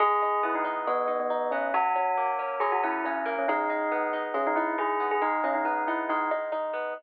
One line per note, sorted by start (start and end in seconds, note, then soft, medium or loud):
0.00 0.87 G#3 medium
0.00 0.40 G#4 loud
0.22 0.64 D#4 medium
0.43 1.51 B3 medium
0.43 0.55 E4 medium
0.55 0.65 D#4 medium
0.65 1.07 D#4 medium
0.87 1.70 G#3 medium
0.87 1.17 B3 medium
1.08 1.30 D#4 medium
1.20 1.49 B3 medium
1.30 1.72 D#4 medium
1.51 1.73 B3 medium
1.51 1.70 C#4 medium
1.74 2.60 F#3 loud
1.74 2.28 F#4 loud
1.96 2.38 C#4 medium
2.17 3.25 A#3 medium
2.39 2.83 C#4 medium
2.60 3.43 F#3 medium
2.60 2.70 G#4 medium
2.72 2.82 F#4 medium
2.83 3.05 C#4 medium
2.83 3.04 E4 medium
3.05 3.33 C#4 medium
3.05 3.47 C#4 medium
3.26 3.46 A#3 medium
3.38 3.49 C#4 medium
3.48 4.34 G#3 loud
3.48 4.05 D#4 medium
3.70 4.13 D#4 medium
3.92 4.99 B3 medium
4.13 4.56 D#4 medium
4.34 5.17 G#3 medium
4.34 4.44 C#4 medium
4.47 4.57 D#4 medium
4.56 4.78 D#4 medium
4.56 4.75 E4 medium
4.78 5.19 D#4 medium
4.78 5.06 G#4 medium
5.00 5.21 B3 medium
5.11 5.22 G#4 medium
5.22 6.09 G#3 medium
5.22 5.40 D#4 loud
5.44 5.54 C#4 medium
5.44 5.87 D#4 medium
5.55 5.64 D#4 medium
5.65 6.73 B3 medium
5.65 5.83 D#4 medium
5.87 6.31 D#4 medium
5.87 5.98 E4 medium
6.09 6.92 G#3 medium
6.09 6.29 D#4 medium
6.31 6.52 D#4 medium
6.52 6.93 D#4 medium
6.73 6.94 B3 medium